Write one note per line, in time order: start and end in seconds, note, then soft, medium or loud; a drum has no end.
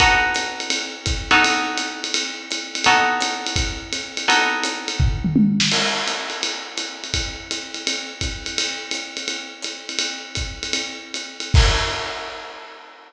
0.00 1.23 B3 medium
0.00 1.23 D#4 medium
0.00 1.23 F#4 medium
0.00 1.23 A4 medium
0.00 kick medium
0.00 ride loud
0.34 hi-hat pedal medium
0.34 ride medium
0.60 ride medium
0.70 ride loud
1.06 kick medium
1.06 hi-hat pedal medium
1.06 ride medium
1.31 2.83 B3 medium
1.31 2.83 D#4 medium
1.31 2.83 F#4 medium
1.31 2.83 A4 medium
1.31 ride medium
1.44 ride loud
1.77 hi-hat pedal medium
1.77 ride medium
2.04 ride medium
2.14 ride loud
2.51 hi-hat pedal medium
2.51 ride medium
2.75 ride medium
2.84 4.27 B3 medium
2.84 4.27 D#4 medium
2.84 4.27 F#4 medium
2.84 4.27 A4 medium
2.84 ride loud
3.20 hi-hat pedal loud
3.20 ride loud
3.47 ride medium
3.56 kick medium
3.56 ride loud
3.93 hi-hat pedal medium
3.93 ride medium
4.17 ride medium
4.28 5.69 B3 medium
4.28 5.69 D#4 medium
4.28 5.69 F#4 medium
4.28 5.69 A4 medium
4.28 ride loud
4.63 hi-hat pedal loud
4.63 ride medium
4.88 ride medium
5.00 kick medium
5.00 floor tom medium
5.24 mid tom medium
5.36 high tom loud
5.60 snare loud
5.72 crash loud
5.72 ride medium
6.07 hi-hat pedal medium
6.07 ride medium
6.30 ride medium
6.43 ride loud
6.77 hi-hat pedal medium
6.77 ride medium
7.04 ride medium
7.14 kick medium
7.14 ride loud
7.51 hi-hat pedal medium
7.51 ride medium
7.74 ride medium
7.87 ride loud
8.21 kick medium
8.21 hi-hat pedal medium
8.21 ride medium
8.46 ride medium
8.58 ride loud
8.91 hi-hat pedal medium
8.91 ride medium
9.17 ride medium
9.28 ride medium
9.62 hi-hat pedal medium
9.62 ride medium
9.89 ride medium
9.99 ride loud
10.35 kick medium
10.35 hi-hat pedal medium
10.35 ride medium
10.63 ride medium
10.73 ride loud
11.14 hi-hat pedal medium
11.14 ride medium
11.40 ride medium
11.54 kick loud
11.54 crash loud